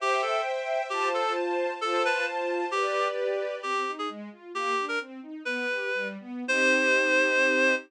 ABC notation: X:1
M:2/4
L:1/16
Q:1/4=132
K:C
V:1 name="Clarinet"
G2 A2 z4 | G2 A2 z4 | A2 B2 z4 | G4 z4 |
[K:Cm] G3 A z4 | G3 B z4 | "^rit." =B6 z2 | c8 |]
V:2 name="String Ensemble 1"
[ceg]8 | [Fca]8 | [Fca]8 | [GBd]8 |
[K:Cm] C2 E2 A,2 F2 | B,2 D2 C2 E2 | "^rit." =B,2 G2 G,2 B,2 | [CEG]8 |]
V:3 name="String Ensemble 1"
[ceg]8 | [Fca]8 | [Fca]8 | [GBd]8 |
[K:Cm] z8 | z8 | "^rit." z8 | z8 |]